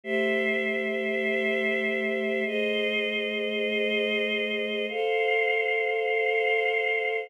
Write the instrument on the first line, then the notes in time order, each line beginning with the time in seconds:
choir aahs
0.04 A3 G4 C5 E5
2.46 A3 G#4 C5 D#5
4.89 A4 C5 F5